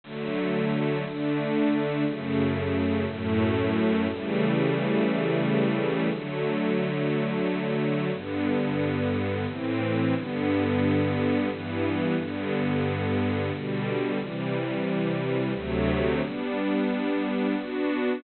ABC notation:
X:1
M:3/4
L:1/8
Q:1/4=89
K:D
V:1 name="String Ensemble 1"
[D,F,A,]3 [D,A,D]3 | [F,,C,A,]3 [F,,A,,A,]3 | [C,E,G,A,]6 | [D,F,A,]6 |
[K:G] [G,,D,B,]4 [A,,E,C]2 | [G,,D,B,]4 [G,,E,B,]2 | [G,,D,B,]4 [B,,D,G,]2 | [C,E,G,]4 [D,,C,F,A,]2 |
[G,B,D]4 [B,DF]2 |]